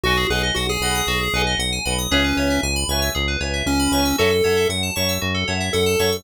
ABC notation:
X:1
M:4/4
L:1/16
Q:1/4=116
K:C#m
V:1 name="Lead 1 (square)"
F2 G z F G7 z4 | C4 z8 C4 | A4 z8 A4 |]
V:2 name="Electric Piano 2"
[Bdfg]2 [Bdfg]4 [Bdfg]4 [Bdfg]4 [Bdfg]2 | [Bceg]2 [Bceg]4 [Bceg]4 [Bceg]4 [Bceg]2 | [cefa]2 [cefa]4 [cefa]4 [cefa]4 [cefa]2 |]
V:3 name="Electric Piano 2"
F G B d f g b d' F G B d f g b d' | G B c e g b c' e' G B c e g b c' e' | F A c e f a c' e' F A c e f a c' e' |]
V:4 name="Synth Bass 1" clef=bass
B,,,2 B,,,2 B,,,2 B,,,2 B,,,2 B,,,2 B,,,2 B,,,2 | C,,2 C,,2 C,,2 C,,2 C,,2 C,,2 C,,2 C,,2 | F,,2 F,,2 F,,2 F,,2 F,,2 F,,2 F,,2 F,,2 |]